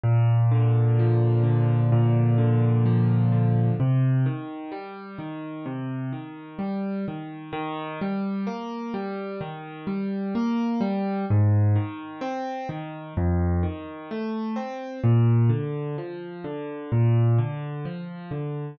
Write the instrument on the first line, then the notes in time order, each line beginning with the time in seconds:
acoustic grand piano
0.04 A#2
0.52 D3
0.99 F3
1.44 D3
1.92 A#2
2.38 D3
2.86 F3
3.32 D3
3.80 C3
4.26 D#3
4.72 G3
5.19 D#3
5.66 C3
6.12 D#3
6.59 G3
7.08 D#3
7.53 D#3
8.02 G3
8.47 A#3
8.94 G3
9.41 D#3
9.87 G3
10.35 A#3
10.81 G3
11.30 G#2
11.76 D#3
12.21 C4
12.69 D#3
13.17 F2
13.63 D#3
14.11 A3
14.56 C4
15.04 A#2
15.49 D3
15.98 F3
16.44 D3
16.92 A#2
17.38 D3
17.85 F3
18.31 D3